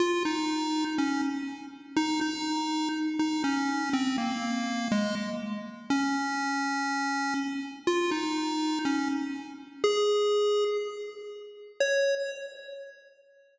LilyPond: \new Staff { \time 2/4 \key des \major \tempo 4 = 61 f'16 ees'8. des'16 r8. | ees'16 ees'8. r16 ees'16 des'8 | c'16 bes8. aes16 r8. | des'4. r8 |
f'16 ees'8. des'16 r8. | aes'4 r4 | des''4 r4 | }